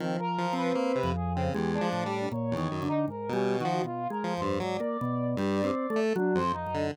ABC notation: X:1
M:3/4
L:1/16
Q:1/4=78
K:none
V:1 name="Drawbar Organ"
(3F,4 C4 F,,4 _A,2 =A,,2 | (3_B,,2 _E,2 D,2 (3_A,,2 G,2 E,2 (3=B,,2 _A,2 F,,2 | _A,, _B, =B,,2 (3G,2 C2 =A,2 (3_G,2 F,,2 _G,,2 |]
V:2 name="Lead 1 (square)"
_E, z F,2 _B, C, z _D, (3=E,,2 F,2 G,2 | z E,, _G,, z2 B,,2 F, z2 F, =G,, | _G, z3 =G,,2 z A, z F,, z D, |]
V:3 name="Brass Section"
C _B2 =B3 _A C G D3 | _d3 _E (3_B2 _D2 _G2 (3F2 B2 c2 | d8 D c _E2 |]